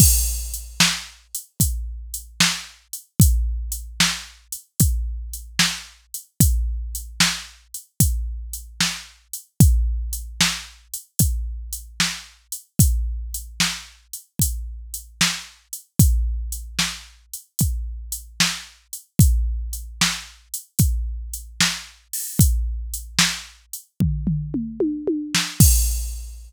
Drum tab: CC |x-----------|------------|------------|------------|
HH |--x--xx-x--x|x-x--xx-x--x|x-x--xx-x--x|x-x--xx-x--x|
SD |---o-----o--|---o-----o--|---o-----o--|---o-----o--|
T1 |------------|------------|------------|------------|
T2 |------------|------------|------------|------------|
FT |------------|------------|------------|------------|
BD |o-----o-----|o-----o-----|o-----o-----|o-----o-----|

CC |------------|------------|------------|------------|
HH |x-x--xx-x--x|x-x--xx-x--x|x-x--xx-x--o|x-x--x------|
SD |---o-----o--|---o-----o--|---o-----o--|---o-------o|
T1 |------------|------------|------------|---------oo-|
T2 |------------|------------|------------|--------o---|
FT |------------|------------|------------|------oo----|
BD |o-----o-----|o-----o-----|o-----o-----|o-----o-----|

CC |x-----------|
HH |------------|
SD |------------|
T1 |------------|
T2 |------------|
FT |------------|
BD |o-----------|